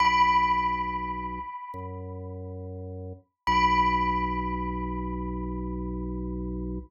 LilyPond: <<
  \new Staff \with { instrumentName = "Tubular Bells" } { \time 4/4 \key b \major \tempo 4 = 69 b''2~ b''8 r4. | b''1 | }
  \new Staff \with { instrumentName = "Drawbar Organ" } { \clef bass \time 4/4 \key b \major b,,2 fis,2 | b,,1 | }
>>